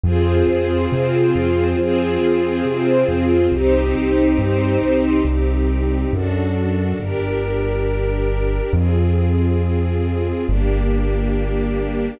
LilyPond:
<<
  \new Staff \with { instrumentName = "String Ensemble 1" } { \time 4/4 \key c \minor \tempo 4 = 138 <c' f' aes'>1 | <c' f' aes'>1 | <c' ees' g'>1 | <c' ees' g'>2 <d' fis' a'>2 |
<d' g' bes'>1 | <c' f' aes'>1 | <bes d' g'>1 | }
  \new Staff \with { instrumentName = "String Ensemble 1" } { \time 4/4 \key c \minor <f' aes' c''>2 <c' f' c''>2 | <f' aes' c''>2 <c' f' c''>2 | <ees' g' c''>2 <c' ees' c''>2 | r1 |
r1 | r1 | r1 | }
  \new Staff \with { instrumentName = "Acoustic Grand Piano" } { \clef bass \time 4/4 \key c \minor f,4 f,4 c4 f,4 | f,4 f,4 c4 f,4 | c,4 c,4 g,4 c,4 | c,2 fis,2 |
g,,1 | f,1 | g,,1 | }
>>